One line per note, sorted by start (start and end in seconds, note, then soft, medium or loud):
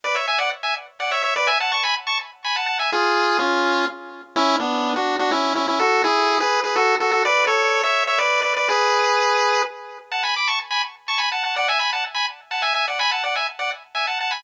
0.04 0.15 B4 medium
0.04 0.15 D5 medium
0.15 0.26 C#5 soft
0.15 0.26 E5 medium
0.28 0.39 E5 medium
0.28 0.39 G#5 medium
0.38 0.50 D5 medium
0.38 0.50 F#5 medium
0.63 0.74 E5 medium
0.63 0.74 G#5 medium
1.00 1.11 D5 medium
1.00 1.11 F#5 medium
1.11 1.22 C#5 medium
1.11 1.22 E5 medium
1.23 1.34 C#5 medium
1.23 1.34 E5 medium
1.36 1.47 B4 medium
1.36 1.47 D5 medium
1.47 1.58 E5 medium
1.47 1.58 G#5 medium
1.60 1.72 F#5 medium
1.60 1.71 A5 medium
1.72 1.83 A5 medium
1.72 1.83 C#6 medium
1.83 1.95 G#5 medium
1.83 1.95 B5 medium
2.07 2.18 A5 medium
2.07 2.18 C#6 medium
2.44 2.56 G#5 medium
2.44 2.56 B5 medium
2.56 2.66 F#5 medium
2.56 2.66 A5 medium
2.66 2.78 F#5 medium
2.66 2.78 A5 medium
2.79 2.91 E5 medium
2.79 2.91 G#5 medium
2.92 3.38 F4 medium
2.92 3.38 G#4 medium
3.39 3.86 C#4 medium
3.39 3.86 F4 medium
4.36 4.56 C#4 medium
4.36 4.56 E4 medium
4.59 4.94 B3 medium
4.59 4.94 D4 medium
4.96 5.16 D4 medium
4.96 5.16 F#4 medium
5.19 5.31 D4 medium
5.19 5.31 F#4 medium
5.31 5.53 C#4 medium
5.31 5.53 E4 medium
5.55 5.67 C#4 medium
5.55 5.67 E4 medium
5.68 5.79 C#4 medium
5.68 5.79 E4 medium
5.79 6.02 F#4 medium
5.79 6.02 A4 medium
6.04 6.38 E4 medium
6.04 6.38 G#4 medium
6.40 6.60 G#4 medium
6.40 6.60 B4 medium
6.64 6.75 G#4 medium
6.64 6.75 B4 medium
6.76 6.95 F#4 medium
6.76 6.95 A4 medium
7.00 7.11 F#4 medium
7.00 7.11 A4 medium
7.11 7.23 F#4 medium
7.11 7.23 A4 medium
7.25 7.44 B4 medium
7.25 7.44 D5 medium
7.47 7.82 A4 medium
7.47 7.82 C#5 medium
7.83 8.04 C#5 medium
7.83 8.04 E5 medium
8.07 8.19 C#5 medium
8.07 8.19 E5 medium
8.18 8.40 B4 medium
8.18 8.40 D5 medium
8.42 8.53 B4 medium
8.42 8.53 D5 medium
8.56 8.68 B4 medium
8.56 8.68 D5 medium
8.69 9.62 G#4 medium
8.69 9.62 B4 medium
10.12 10.23 F#5 medium
10.12 10.23 A5 medium
10.23 10.35 G#5 medium
10.23 10.35 B5 medium
10.36 10.48 B5 medium
10.36 10.48 D6 medium
10.47 10.59 A5 medium
10.47 10.59 C#6 medium
10.71 10.82 G#5 medium
10.71 10.82 B5 medium
11.08 11.19 A5 medium
11.08 11.19 C#6 medium
11.18 11.29 G#5 medium
11.18 11.29 B5 medium
11.32 11.43 F#5 medium
11.32 11.43 A5 medium
11.44 11.55 F#5 medium
11.44 11.55 A5 medium
11.56 11.68 D5 medium
11.56 11.68 F#5 medium
11.68 11.80 E5 medium
11.68 11.79 G#5 medium
11.79 11.91 G#5 medium
11.79 11.91 B5 medium
11.93 12.04 F#5 medium
11.93 12.04 A5 medium
12.14 12.26 G#5 medium
12.14 12.26 B5 medium
12.51 12.62 F#5 medium
12.51 12.62 A5 medium
12.62 12.73 E5 medium
12.62 12.73 G#5 medium
12.74 12.86 E5 medium
12.74 12.86 G#5 medium
12.88 12.99 D5 soft
12.88 12.99 F#5 medium
12.99 13.11 G#5 medium
12.99 13.11 B5 medium
13.11 13.23 F#5 medium
13.11 13.23 A5 medium
13.24 13.35 D5 medium
13.24 13.35 F#5 medium
13.36 13.47 E5 soft
13.36 13.47 G#5 medium
13.59 13.70 D5 medium
13.59 13.70 F#5 medium
13.95 14.06 E5 medium
13.95 14.06 G#5 medium
14.07 14.19 F#5 medium
14.07 14.19 A5 medium
14.20 14.32 F#5 medium
14.20 14.32 A5 medium
14.31 14.42 G#5 medium
14.31 14.42 B5 medium